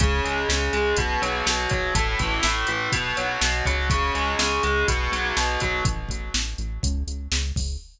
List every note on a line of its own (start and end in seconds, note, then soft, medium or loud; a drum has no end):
0.00 0.21 C#2 loud
0.00 0.48 C#3 loud
0.00 kick medium
0.00 closed hi-hat medium
0.24 0.45 C#2 medium
0.24 0.73 G#3 medium
0.24 closed hi-hat medium
0.49 0.70 C#2 loud
0.49 0.95 C#3 medium
0.49 snare medium
0.73 0.94 C#2 medium
0.73 0.96 G#3 medium
0.73 closed hi-hat medium
0.97 1.18 B1 loud
0.97 1.46 B2 loud
0.97 kick medium
0.97 closed hi-hat medium
1.22 1.43 B1 loud
1.22 1.70 F#3 loud
1.22 closed hi-hat medium
1.46 1.67 B1 loud
1.46 1.93 B2 medium
1.46 snare loud
1.70 1.92 B1 loud
1.70 1.94 F#3 medium
1.70 kick medium
1.70 closed hi-hat medium
1.95 2.16 A1 loud
1.95 2.43 A2 medium
1.95 kick medium
1.95 closed hi-hat medium
2.19 2.40 A1 medium
2.19 2.68 E3 medium
2.19 kick medium
2.19 closed hi-hat medium
2.43 2.65 A1 loud
2.43 2.90 A2 medium
2.43 snare loud
2.67 2.89 A1 loud
2.67 2.91 E3 medium
2.67 closed hi-hat medium
2.92 3.14 B1 loud
2.92 3.41 B2 loud
2.92 kick medium
2.92 closed hi-hat medium
3.17 3.38 B1 medium
3.17 3.65 F#3 medium
3.17 closed hi-hat medium
3.41 3.62 B1 loud
3.41 3.88 B2 medium
3.41 snare loud
3.65 4.11 C#2 loud
3.65 3.89 F#3 medium
3.65 kick medium
3.65 closed hi-hat medium
3.90 4.39 C#3 loud
3.90 kick medium
3.90 closed hi-hat medium
4.15 4.35 C#2 loud
4.15 4.63 G#3 medium
4.15 closed hi-hat medium
4.39 4.60 C#2 loud
4.39 4.85 C#3 medium
4.39 snare loud
4.63 4.84 C#2 medium
4.63 4.87 G#3 medium
4.63 closed hi-hat medium
4.88 5.09 B1 loud
4.88 5.36 B2 loud
4.88 kick medium
4.88 closed hi-hat medium
5.12 5.33 B1 medium
5.12 5.60 F#3 medium
5.12 closed hi-hat medium
5.37 5.58 B1 loud
5.37 5.83 B2 medium
5.37 snare medium
5.60 5.82 B1 loud
5.60 5.84 F#3 medium
5.60 kick medium
5.60 closed hi-hat medium
5.85 6.06 A1 loud
5.85 kick medium
5.85 closed hi-hat medium
6.09 6.30 A1 loud
6.09 kick medium
6.09 closed hi-hat medium
6.34 6.55 A1 loud
6.34 snare loud
6.58 6.79 A1 medium
6.58 closed hi-hat medium
6.83 7.04 C#2 loud
6.83 kick medium
6.83 closed hi-hat medium
7.07 7.28 C#2 medium
7.07 closed hi-hat medium
7.32 7.52 C#2 loud
7.32 snare medium
7.56 7.77 C#2 medium
7.56 kick medium
7.56 open hi-hat medium